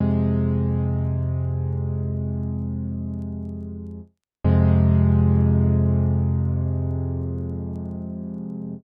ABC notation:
X:1
M:4/4
L:1/8
Q:1/4=54
K:Fm
V:1 name="Acoustic Grand Piano" clef=bass
[F,,C,A,]8 | [F,,C,A,]8 |]